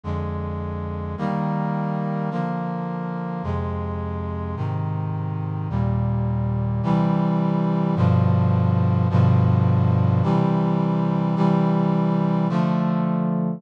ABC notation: X:1
M:2/2
L:1/8
Q:1/2=53
K:Eb
V:1 name="Brass Section"
[F,,D,A,]4 [E,G,B,]4 | [D,F,B,]4 [F,,C,A,]4 | [A,,C,E,]4 [E,,B,,G,]4 | [K:C] [C,E,G,]4 [G,,B,,D,F,]4 |
[G,,B,,D,F,]4 [C,E,G,]4 | [C,E,G,]4 [D,F,A,]4 |]